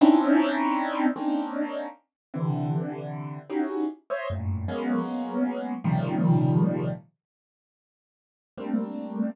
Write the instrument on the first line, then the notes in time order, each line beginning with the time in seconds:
acoustic grand piano
0.01 C4 C#4 D4 D#4 E4
1.16 A#3 C4 C#4 D4 D#4
2.34 C3 D3 E3
3.50 C#4 D#4 E4 F#4 G4 G#4
4.10 C5 C#5 D#5 E5
4.30 F#2 G2 A2 A#2
4.68 F#3 G#3 A#3 B3 C#4
5.84 A#2 C3 C#3 D#3 F3 G3
8.57 G3 A3 A#3 C4 D4